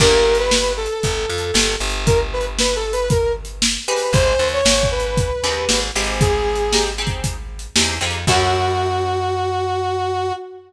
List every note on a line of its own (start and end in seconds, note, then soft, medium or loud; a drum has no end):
0.00 0.88 G1 loud
0.00 0.37 A#3 loud
0.00 0.37 D4 loud
0.00 0.37 G4 loud
0.00 0.37 A#4 medium
0.00 kick loud
0.00 crash loud
0.35 closed hi-hat medium
0.39 0.72 B4 medium
0.51 snare loud
0.77 1.75 A4 medium
0.86 closed hi-hat medium
1.03 1.26 G1 medium
1.03 kick medium
1.03 closed hi-hat loud
1.30 1.52 F2 medium
1.38 closed hi-hat medium
1.54 1.76 G1 medium
1.54 snare loud
1.80 3.78 G1 medium
1.90 closed hi-hat medium
2.06 2.19 A#4 medium
2.06 kick loud
2.06 closed hi-hat loud
2.33 2.45 B4 medium
2.41 closed hi-hat medium
2.59 2.76 B4 medium
2.59 snare loud
2.76 2.92 A4 medium
2.93 3.09 B4 medium
2.93 closed hi-hat medium
3.10 3.32 A#4 medium
3.10 kick loud
3.10 closed hi-hat loud
3.45 closed hi-hat medium
3.62 snare loud
3.88 4.50 C4 loud
3.88 4.50 D#4 loud
3.88 4.50 G4 loud
3.88 4.50 G#4 loud
3.88 4.13 B4 medium
3.96 open hi-hat medium
4.13 4.35 G#1 medium
4.13 4.48 C5 medium
4.13 kick loud
4.13 closed hi-hat loud
4.39 4.61 D#2 medium
4.48 closed hi-hat medium
4.53 4.87 C#5 medium
4.65 5.31 G#1 medium
4.65 snare loud
4.83 kick medium
4.91 5.80 B4 medium
5.00 closed hi-hat medium
5.17 kick loud
5.17 closed hi-hat loud
5.44 5.66 D#2 medium
5.44 5.80 C4 loud
5.44 5.80 D#4 loud
5.44 5.80 G4 medium
5.44 5.80 G#4 loud
5.52 closed hi-hat medium
5.69 5.91 G#1 medium
5.69 snare loud
5.95 7.67 G#1 medium
5.95 6.32 C4 loud
5.95 6.32 D#4 medium
5.95 6.32 G4 loud
5.95 6.32 G#4 loud
6.03 open hi-hat medium
6.21 6.84 G#4 medium
6.21 kick loud
6.21 closed hi-hat loud
6.55 closed hi-hat medium
6.73 6.91 C4 medium
6.73 6.91 D#4 medium
6.73 6.91 G4 medium
6.73 6.91 G#4 loud
6.73 snare loud
6.98 7.34 C4 medium
6.98 7.34 D#4 loud
6.98 7.34 G4 medium
6.98 7.34 G#4 medium
7.07 kick medium
7.07 closed hi-hat medium
7.24 kick medium
7.24 closed hi-hat loud
7.59 closed hi-hat medium
7.76 7.99 E2 medium
7.76 7.94 C4 medium
7.76 7.94 D#4 medium
7.76 7.94 G4 medium
7.76 7.94 G#4 medium
7.76 snare loud
8.01 8.25 F2 medium
8.01 8.19 C4 medium
8.01 8.19 D#4 medium
8.01 8.19 G4 medium
8.01 8.19 G#4 loud
8.11 closed hi-hat medium
8.27 10.32 F#2 loud
8.27 10.33 C#4 medium
8.27 10.33 E4 loud
8.27 10.32 F#4 loud
8.27 10.33 F#4 medium
8.27 10.33 A4 loud
8.27 kick loud
8.27 crash loud